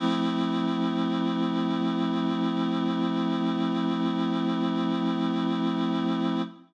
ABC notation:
X:1
M:4/4
L:1/8
Q:1/4=74
K:F
V:1 name="Clarinet"
[F,A,CE]8- | [F,A,CE]8 | z8 |]